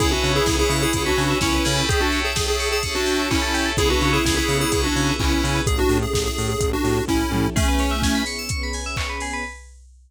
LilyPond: <<
  \new Staff \with { instrumentName = "Lead 1 (square)" } { \time 4/4 \key cis \phrygian \tempo 4 = 127 <e' gis'>16 <d' fis'>8 <e' gis'>8 <e' gis'>8 <e' gis'>8 <d' fis'>8. <cis' e'>4 | gis'16 <d' fis'>8 gis'8 gis'8 gis'8 <d' fis'>8. <cis' e'>4 | <e' gis'>16 <d' fis'>8 <e' gis'>8 <e' gis'>8 <e' gis'>8 <d' fis'>8. <cis' e'>4 | gis'16 <d' fis'>8 gis'8 gis'8 gis'8 <d' fis'>8. <cis' e'>4 |
<a cis'>4. r2 r8 | }
  \new Staff \with { instrumentName = "Electric Piano 2" } { \time 4/4 \key cis \phrygian <b cis' e' gis'>4 <b cis' e' gis'>4 <b cis' e' gis'>4 <b cis' e' gis'>8 <cis' e' g' a'>8~ | <cis' e' g' a'>4 <cis' e' g' a'>4 <cis' e' g' a'>4 <cis' e' g' a'>4 | <b cis' e' gis'>4 <b cis' e' gis'>4 <b cis' e' gis'>4 <b cis' e' gis'>4 | r1 |
r1 | }
  \new Staff \with { instrumentName = "Electric Piano 2" } { \time 4/4 \key cis \phrygian gis'16 b'16 cis''16 e''16 gis''16 b''16 cis'''16 e'''16 cis'''16 b''16 gis''16 e''16 cis''16 b'16 gis'16 b'16 | g'16 a'16 cis''16 e''16 g''16 a''16 cis'''16 e'''16 cis'''16 a''16 g''16 e''16 cis''16 a'16 g'16 a'16 | gis'16 b'16 cis''16 e''16 gis''16 b''16 cis'''16 e'''16 cis'''16 b''16 gis''16 e''16 cis''16 b'16 gis'16 b'16 | r1 |
gis'16 b'16 cis''16 e''16 gis''16 b''16 cis'''16 e'''16 cis'''16 b''16 gis''16 e''16 cis''16 b'16 gis'16 b'16 | }
  \new Staff \with { instrumentName = "Synth Bass 1" } { \clef bass \time 4/4 \key cis \phrygian cis,8 cis8 cis,8 cis8 cis,8 cis8 cis,8 cis8 | r1 | cis,8 cis8 cis,8 cis8 cis,8 cis8 cis,8 cis8 | a,,8 a,8 a,,8 a,8 a,,8 a,8 a,,8 a,8 |
r1 | }
  \new Staff \with { instrumentName = "String Ensemble 1" } { \time 4/4 \key cis \phrygian <b' cis'' e'' gis''>2 <b' cis'' gis'' b''>2 | <cis'' e'' g'' a''>2 <cis'' e'' a'' cis'''>2 | <b cis' e' gis'>1 | <cis' e' g' a'>1 |
<b cis' e' gis'>2 <b cis' gis' b'>2 | }
  \new DrumStaff \with { instrumentName = "Drums" } \drummode { \time 4/4 <hh bd>8 hho8 <bd sn>8 hho8 <hh bd>8 hho8 <bd sn>8 hho8 | <hh bd>8 hho8 <bd sn>8 hho8 <hh bd>8 hho8 <hc bd>8 hho8 | <hh bd>8 hho8 <bd sn>8 hho8 <hh bd>8 hho8 <hc bd>8 hho8 | <hh bd>8 hho8 <bd sn>8 hho8 <hh bd>8 hho8 <bd sn>8 toml8 |
<cymc bd>8 hho8 <bd sn>8 hho8 <hh bd>8 hho8 <hc bd>8 hho8 | }
>>